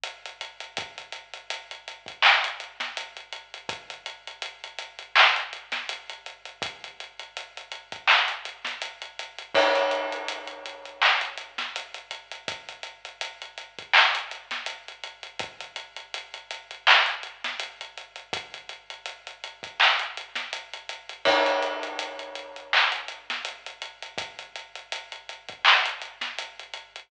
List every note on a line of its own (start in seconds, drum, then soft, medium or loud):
0.04 closed hi-hat loud
0.25 closed hi-hat medium
0.41 closed hi-hat loud
0.60 closed hi-hat medium
0.77 kick loud
0.77 closed hi-hat loud
0.98 closed hi-hat medium
1.12 closed hi-hat medium
1.34 closed hi-hat medium
1.50 closed hi-hat loud
1.71 closed hi-hat medium
1.88 closed hi-hat medium
2.06 kick medium
2.06 closed hi-hat medium
2.22 clap loud
2.44 closed hi-hat loud
2.60 closed hi-hat medium
2.80 snare medium
2.80 closed hi-hat medium
2.97 closed hi-hat loud
3.17 closed hi-hat medium
3.32 closed hi-hat medium
3.54 closed hi-hat medium
3.69 kick loud
3.69 closed hi-hat loud
3.90 closed hi-hat medium
4.06 closed hi-hat loud
4.27 closed hi-hat medium
4.42 closed hi-hat loud
4.64 closed hi-hat medium
4.79 closed hi-hat loud
4.99 closed hi-hat medium
5.16 clap loud
5.36 closed hi-hat medium
5.53 closed hi-hat medium
5.72 snare medium
5.72 closed hi-hat medium
5.89 closed hi-hat loud
6.09 closed hi-hat medium
6.26 closed hi-hat medium
6.45 closed hi-hat medium
6.62 kick loud
6.62 closed hi-hat loud
6.84 closed hi-hat medium
7.00 closed hi-hat medium
7.19 closed hi-hat medium
7.37 closed hi-hat loud
7.57 closed hi-hat medium
7.71 closed hi-hat medium
7.92 kick medium
7.92 closed hi-hat medium
8.07 clap loud
8.28 closed hi-hat medium
8.45 closed hi-hat medium
8.65 snare medium
8.65 closed hi-hat medium
8.82 closed hi-hat loud
9.02 closed hi-hat medium
9.19 closed hi-hat loud
9.38 closed hi-hat medium
9.54 kick loud
9.54 crash loud
9.75 closed hi-hat medium
9.91 closed hi-hat medium
10.12 closed hi-hat medium
10.28 closed hi-hat loud
10.47 closed hi-hat medium
10.66 closed hi-hat medium
10.85 closed hi-hat medium
11.02 clap loud
11.21 closed hi-hat medium
11.37 closed hi-hat medium
11.58 snare medium
11.58 closed hi-hat medium
11.76 closed hi-hat loud
11.94 closed hi-hat medium
12.11 closed hi-hat loud
12.31 closed hi-hat medium
12.48 kick loud
12.48 closed hi-hat loud
12.69 closed hi-hat medium
12.83 closed hi-hat medium
13.05 closed hi-hat medium
13.21 closed hi-hat loud
13.42 closed hi-hat medium
13.58 closed hi-hat medium
13.79 kick medium
13.79 closed hi-hat medium
13.93 clap loud
14.15 closed hi-hat loud
14.31 closed hi-hat medium
14.51 snare medium
14.51 closed hi-hat medium
14.66 closed hi-hat loud
14.88 closed hi-hat medium
15.04 closed hi-hat medium
15.23 closed hi-hat medium
15.39 kick loud
15.39 closed hi-hat loud
15.60 closed hi-hat medium
15.76 closed hi-hat loud
15.96 closed hi-hat medium
16.14 closed hi-hat loud
16.34 closed hi-hat medium
16.51 closed hi-hat loud
16.71 closed hi-hat medium
16.87 clap loud
17.06 closed hi-hat medium
17.23 closed hi-hat medium
17.44 snare medium
17.44 closed hi-hat medium
17.59 closed hi-hat loud
17.81 closed hi-hat medium
17.97 closed hi-hat medium
18.16 closed hi-hat medium
18.33 kick loud
18.33 closed hi-hat loud
18.54 closed hi-hat medium
18.69 closed hi-hat medium
18.90 closed hi-hat medium
19.06 closed hi-hat loud
19.27 closed hi-hat medium
19.44 closed hi-hat medium
19.63 kick medium
19.63 closed hi-hat medium
19.80 clap loud
19.99 closed hi-hat medium
20.17 closed hi-hat medium
20.35 snare medium
20.35 closed hi-hat medium
20.53 closed hi-hat loud
20.73 closed hi-hat medium
20.89 closed hi-hat loud
21.09 closed hi-hat medium
21.25 kick loud
21.25 crash loud
21.46 closed hi-hat medium
21.62 closed hi-hat medium
21.83 closed hi-hat medium
21.99 closed hi-hat loud
22.19 closed hi-hat medium
22.35 closed hi-hat medium
22.56 closed hi-hat medium
22.73 clap loud
22.92 closed hi-hat medium
23.08 closed hi-hat medium
23.30 snare medium
23.30 closed hi-hat medium
23.45 closed hi-hat loud
23.66 closed hi-hat medium
23.82 closed hi-hat loud
24.02 closed hi-hat medium
24.18 kick loud
24.18 closed hi-hat loud
24.39 closed hi-hat medium
24.55 closed hi-hat medium
24.75 closed hi-hat medium
24.92 closed hi-hat loud
25.12 closed hi-hat medium
25.29 closed hi-hat medium
25.48 kick medium
25.48 closed hi-hat medium
25.65 clap loud
25.86 closed hi-hat loud
26.02 closed hi-hat medium
26.21 snare medium
26.21 closed hi-hat medium
26.38 closed hi-hat loud
26.59 closed hi-hat medium
26.73 closed hi-hat medium
26.96 closed hi-hat medium